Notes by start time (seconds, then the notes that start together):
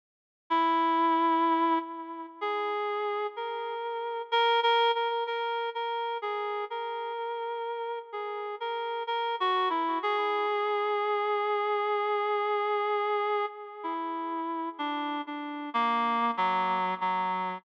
0.50 E4
2.41 G#4
3.36 A#4
4.32 A#4
4.63 A#4
4.95 A#4
5.27 A#4
5.75 A#4
6.22 G#4
6.70 A#4
8.12 G#4
8.60 A#4
9.07 A#4
9.40 F#4
9.70 E4
10.03 G#4
13.83 E4
14.78 D4
15.27 D4
15.74 A#3
16.37 F#3
17.01 F#3